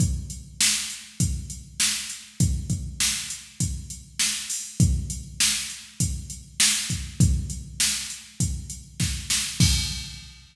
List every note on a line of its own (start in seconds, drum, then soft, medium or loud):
0.00 kick loud
0.00 closed hi-hat medium
0.30 closed hi-hat medium
0.60 snare loud
0.90 closed hi-hat medium
1.20 kick medium
1.20 closed hi-hat loud
1.50 closed hi-hat medium
1.80 snare loud
2.10 closed hi-hat medium
2.40 kick loud
2.40 closed hi-hat loud
2.70 kick medium
2.70 closed hi-hat medium
3.00 snare loud
3.30 closed hi-hat medium
3.60 kick medium
3.60 closed hi-hat loud
3.90 closed hi-hat medium
4.19 snare loud
4.50 open hi-hat medium
4.80 kick loud
4.80 closed hi-hat loud
5.10 closed hi-hat medium
5.40 snare loud
5.70 closed hi-hat medium
6.00 kick medium
6.00 closed hi-hat loud
6.30 closed hi-hat medium
6.60 snare loud
6.90 kick medium
6.90 closed hi-hat medium
7.20 kick loud
7.20 closed hi-hat loud
7.50 closed hi-hat medium
7.80 snare loud
8.10 closed hi-hat medium
8.40 kick medium
8.40 closed hi-hat loud
8.70 closed hi-hat medium
9.00 kick medium
9.00 snare medium
9.30 snare loud
9.60 kick loud
9.60 crash loud